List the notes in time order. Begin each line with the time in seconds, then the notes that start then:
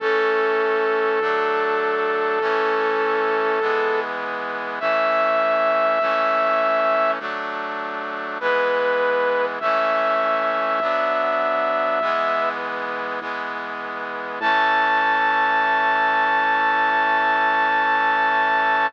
0.00 A1 E3 A3 C#4 A4
1.21 D2 F#3 A3 D4
2.39 A1 E3 A3 C#4
3.60 G#1 E3 G#3 B3
4.80 A1 E3 A3 C#4 E5
6.00 C#2 E3 A3 C#4
7.19 D2 F#3 A3 D4
8.40 G#1 E3 G#3 B3 B4
9.60 C#2 E3 A3 C#4 E5
10.79 B1 F#3 B3 D4
12.00 B1 E3 G#3 B3
13.20 E2 E3 G#3 B3
14.40 A2 E3 A3 C#4 A5